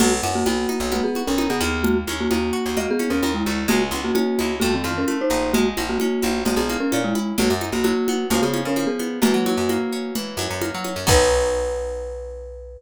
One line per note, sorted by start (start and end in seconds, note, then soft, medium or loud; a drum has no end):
0.00 0.21 B1 medium
0.00 0.10 A#3 medium
0.00 0.47 B3 loud
0.00 0.10 F#4 medium
0.00 crash loud
0.00 low conga loud
0.23 0.44 F#2 medium
0.23 1.16 F#4 loud
0.23 high conga medium
0.35 0.46 A#3 medium
0.35 0.46 F#4 medium
0.46 0.67 B1 medium
0.46 0.90 A#3 medium
0.46 0.91 B3 medium
0.46 0.90 F#4 medium
0.46 high conga medium
0.69 1.37 D#4 medium
0.69 high conga medium
0.80 1.01 B1 medium
0.92 1.03 A#3 medium
0.92 1.79 B3 medium
0.92 1.03 F#4 medium
0.92 low conga medium
1.04 1.23 B3 medium
1.04 1.23 G#4 medium
1.15 1.82 F#4 medium
1.15 high conga medium
1.27 1.48 B1 medium
1.27 1.48 C#4 medium
1.27 1.48 A#4 medium
1.38 1.82 D#4 medium
1.38 high conga loud
1.50 1.61 B2 medium
1.50 1.84 B3 medium
1.50 1.84 G#4 medium
1.60 2.04 D#2 medium
1.60 2.77 A#3 loud
1.60 high conga medium
1.84 1.95 A#3 medium
1.84 1.95 F#4 medium
1.84 low conga loud
2.07 2.28 D#2 medium
2.07 2.99 C#4 medium
2.07 high conga medium
2.20 2.31 A#3 medium
2.20 2.31 F#4 medium
2.31 2.52 D#2 medium
2.31 2.76 A#3 medium
2.31 3.23 D#4 medium
2.31 2.76 F#4 medium
2.31 high conga loud
2.53 3.47 F#4 loud
2.66 2.86 D#2 medium
2.77 3.65 A#3 medium
2.77 2.88 F#4 medium
2.77 2.88 D#5 medium
2.77 low conga medium
2.91 3.11 B3 medium
2.91 3.11 G#4 medium
2.99 3.65 C#4 medium
2.99 high conga medium
3.10 3.21 D#2 medium
3.10 3.31 C#4 medium
3.10 3.31 A#4 medium
3.22 3.43 D#2 medium
3.22 3.67 D#4 medium
3.22 high conga loud
3.34 3.64 G#3 medium
3.34 3.64 E4 medium
3.46 3.67 D2 medium
3.46 3.69 F#4 medium
3.46 high conga medium
3.68 3.91 C#2 medium
3.68 4.56 G#3 loud
3.68 3.80 A#3 medium
3.68 3.80 F#4 medium
3.68 low conga loud
3.91 4.12 C#2 medium
3.91 4.58 B3 medium
3.91 high conga medium
4.04 4.14 A#3 medium
4.04 4.14 F#4 medium
4.15 4.52 A#3 medium
4.15 4.59 C#4 medium
4.15 4.52 F#4 medium
4.15 high conga loud
4.39 4.61 C#2 medium
4.39 4.61 E4 medium
4.39 high conga medium
4.60 4.82 F2 medium
4.60 5.07 A3 loud
4.60 4.71 A#3 medium
4.60 4.71 F#4 medium
4.60 low conga loud
4.75 4.93 D#3 medium
4.75 4.93 C4 medium
4.84 5.05 F2 medium
4.84 5.51 F4 medium
4.84 high conga medium
4.98 5.18 C#4 medium
4.98 5.18 A#4 medium
5.08 5.52 A3 medium
5.08 high conga medium
5.21 5.51 D#4 medium
5.21 5.51 C5 medium
5.30 5.74 A#1 medium
5.30 5.52 D#4 medium
5.53 6.47 G#3 loud
5.53 5.64 A#3 medium
5.53 5.64 F#4 medium
5.53 low conga loud
5.77 5.98 A#1 medium
5.77 6.69 A#3 medium
5.77 high conga loud
5.89 5.98 A#3 medium
5.89 5.98 F#4 medium
5.99 6.39 A#3 medium
5.99 6.92 C#4 medium
5.99 6.39 F#4 medium
5.99 high conga medium
6.22 6.44 A#1 medium
6.22 7.15 E4 medium
6.22 high conga medium
6.45 6.56 A#1 medium
6.45 7.35 G#3 medium
6.45 6.57 A#3 medium
6.45 6.57 F#4 medium
6.45 low conga loud
6.56 6.77 A#1 medium
6.56 6.78 B3 medium
6.56 6.78 G#4 medium
6.69 7.35 A#3 medium
6.69 high conga medium
6.80 7.00 C#4 medium
6.80 7.00 A#4 medium
6.92 7.14 A#2 medium
6.92 7.36 C#4 medium
6.92 high conga loud
7.04 7.32 G#3 medium
7.04 7.32 E4 medium
7.15 7.37 E4 medium
7.15 high conga medium
7.38 7.49 B1 medium
7.38 7.83 F#3 loud
7.38 7.50 A#3 medium
7.38 7.50 F#4 medium
7.38 low conga loud
7.50 7.71 F#2 medium
7.61 8.27 D#4 medium
7.61 high conga medium
7.72 7.93 B1 medium
7.72 7.84 A#3 medium
7.72 7.84 F#4 medium
7.84 8.28 F#3 medium
7.84 8.24 A#3 medium
7.84 8.24 F#4 medium
7.84 high conga medium
8.08 8.31 B3 medium
8.08 high conga loud
8.30 8.41 C#2 medium
8.30 8.76 F3 loud
8.30 8.42 A#3 medium
8.30 8.42 F#4 medium
8.30 low conga medium
8.42 8.64 C#3 medium
8.42 8.61 B3 medium
8.42 8.61 G#4 medium
8.54 9.19 C#4 medium
8.54 high conga loud
8.65 8.86 C#3 medium
8.65 8.88 C#4 medium
8.65 8.88 A#4 medium
8.76 9.20 F3 medium
8.76 high conga medium
8.87 9.19 B3 medium
8.87 9.19 G#4 medium
8.99 9.21 B3 medium
8.99 high conga medium
9.22 9.32 F#2 medium
9.22 10.15 E3 loud
9.22 10.11 A#3 medium
9.22 10.11 F#4 medium
9.22 low conga loud
9.34 9.55 F#3 medium
9.46 10.38 F#3 medium
9.46 high conga loud
9.57 9.78 F#2 medium
9.69 10.61 A#3 medium
9.69 high conga loud
9.92 10.84 C#4 medium
10.15 11.03 E3 medium
10.15 low conga loud
10.37 10.47 F#2 medium
10.37 11.04 F#3 loud
10.37 high conga medium
10.50 10.71 F#2 medium
10.61 11.05 A#3 medium
10.61 high conga loud
10.75 10.95 F#3 medium
10.84 11.06 C#4 medium
10.84 high conga medium
10.96 11.06 F#2 medium
11.07 12.77 B1 loud
11.07 12.75 B3 loud
11.07 12.75 D#4 loud
11.07 12.75 F#4 medium
11.07 12.78 B4 loud
11.07 kick loud
11.07 crash loud